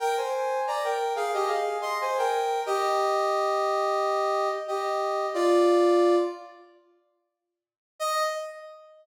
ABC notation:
X:1
M:4/4
L:1/16
Q:1/4=90
K:Eb
V:1 name="Brass Section"
[Bg] [ca]3 [db] [Bg]2 [Af] [Ge] [Af]2 [ec'] [ca] [Bg]3 | [Ge]12 [Ge]4 | [Fd]6 z10 | e4 z12 |]